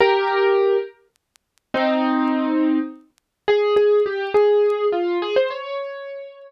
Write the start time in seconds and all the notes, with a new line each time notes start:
0.00 G4 A#4
1.74 C4 D#4
3.48 G#4
3.76 G#4
4.06 G4
4.34 G#4
4.92 F4
5.22 G#4
5.36 C5
5.50 C#5